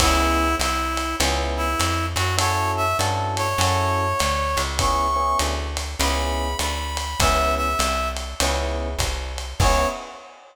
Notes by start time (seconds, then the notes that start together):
0.00 C#2 B3 C#4 E4 G#4, kick, crash, ride
0.59 C2 E4, hi-hat pedal, ride
0.97 ride
1.20 C#2 B3 C#4 E4 G#4, ride
1.57 E4
1.79 F2, hi-hat pedal, ride
2.16 F#2 F#4, ride
2.37 C#4 E4 F#4 A4 C#5, ride
2.77 E5
2.99 G2 C#4 E4 F#4 A4, hi-hat pedal, ride
3.37 C#5, ride
3.58 F#2 C#4 E4 F#4 A4, ride
4.19 D2, hi-hat pedal, ride
4.57 C#2, ride
4.79 B3 C#4 E4 G#4 C#6, kick, ride
5.16 B3 C#4 E4 G#4
5.39 D2, hi-hat pedal, ride
5.77 ride
6.00 C#2 B3 C#4 E4 G#4 B5, ride
6.59 D2 B5, hi-hat pedal, ride
6.97 ride
7.20 C#2 B3 C#4 E4 G#4 E5, kick, ride
7.57 E5
7.79 C2, hi-hat pedal, ride
8.17 ride
8.40 C#2 B3 C#4 E4 G#4, ride
8.98 C2, kick, hi-hat pedal, ride
9.38 ride
9.60 C#2 B3 C#4 E4 G#4 C#5, kick, crash